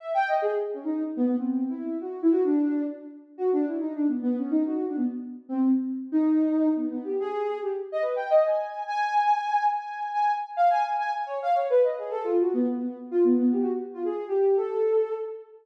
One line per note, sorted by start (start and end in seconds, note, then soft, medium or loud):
0.00 0.13 E5 medium
0.14 0.27 G5 loud
0.28 0.41 D#5 medium
0.42 0.51 G#4 loud
0.74 0.83 C#4 medium
0.84 1.03 D#4 medium
1.16 1.26 B3 loud
1.26 1.36 B3 loud
1.37 1.65 C4 medium
1.69 1.98 E4 medium
2.01 2.20 F#4 medium
2.22 2.32 E4 loud
2.32 2.41 F#4 loud
2.44 2.82 D4 loud
3.38 3.50 F#4 medium
3.53 3.65 D4 loud
3.67 3.79 E4 medium
3.80 3.93 D#4 medium
3.95 4.07 D4 medium
4.08 4.21 B3 medium
4.22 4.35 B3 loud
4.37 4.50 C#4 medium
4.51 4.63 D#4 medium
4.65 4.85 F#4 medium
4.87 4.97 D4 medium
4.96 5.06 B3 medium
5.49 5.68 C4 loud
6.12 6.69 D#4 loud
6.76 6.88 B3 medium
6.90 7.03 B3 medium
7.04 7.17 G4 soft
7.20 7.58 G#4 loud
7.62 7.71 G4 medium
7.92 8.02 D#5 loud
8.02 8.15 B4 medium
8.16 8.29 G5 medium
8.30 8.43 D#5 loud
8.45 8.83 G#5 soft
8.87 9.63 G#5 loud
9.72 10.10 G#5 medium
10.13 10.32 G#5 medium
10.57 10.69 F5 loud
10.70 10.83 G#5 loud
10.84 10.97 G#5 medium
10.98 11.11 G#5 medium
11.13 11.25 G#5 medium
11.26 11.39 C#5 medium
11.42 11.55 F5 loud
11.54 11.67 C#5 medium
11.70 11.83 B4 loud
11.83 11.96 D#5 medium
11.98 12.11 G#4 medium
12.10 12.23 A4 loud
12.24 12.37 F4 loud
12.40 12.53 F#4 medium
12.54 12.66 B3 loud
12.77 12.96 B3 medium
13.11 13.24 F4 loud
13.24 13.37 B3 loud
13.38 13.51 B3 loud
13.52 13.62 G4 medium
13.61 13.71 F#4 medium
13.94 14.03 F4 medium
14.05 14.24 G#4 medium
14.28 14.56 G4 medium
14.56 15.13 A4 medium